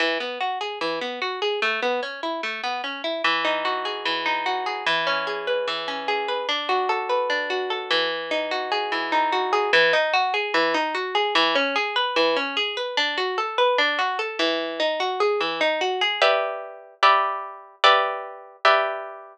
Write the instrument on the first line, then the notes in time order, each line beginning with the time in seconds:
orchestral harp
0.00 E3
0.20 B3
0.41 F#4
0.61 G#4
0.81 E3
1.01 B3
1.22 F#4
1.42 G#4
1.62 A3
1.82 B3
2.03 C#4
2.23 E4
2.43 A3
2.64 B3
2.84 C#4
3.04 E4
3.24 E3
3.45 D#4
3.65 F#4
3.85 G#4
4.05 E3
4.26 D#4
4.46 F#4
4.66 G#4
4.86 E3
5.07 C#4
5.27 G#4
5.47 B4
5.68 E3
5.88 C#4
6.08 G#4
6.28 B4
6.49 D4
6.69 F#4
6.89 A4
7.09 B4
7.30 D4
7.50 F#4
7.70 A4
7.91 E3
8.31 D#4
8.51 F#4
8.72 G#4
8.92 E3
9.12 D#4
9.32 F#4
9.53 G#4
9.73 E3
9.93 D#4
10.14 F#4
10.34 G#4
10.54 E3
10.74 D#4
10.95 F#4
11.15 G#4
11.35 E3
11.55 C#4
11.76 G#4
11.96 B4
12.16 E3
12.36 C#4
12.57 G#4
12.77 B4
12.97 D4
13.18 F#4
13.38 A4
13.58 B4
13.78 D4
13.99 F#4
14.19 A4
14.39 E3
14.80 D#4
15.00 F#4
15.20 G#4
15.41 E3
15.61 D#4
15.81 F#4
16.01 G#4
16.22 G4 B4 D5 E5
17.03 G4 B4 D5 E5
17.84 G4 B4 D5 E5
18.65 G4 B4 D5 E5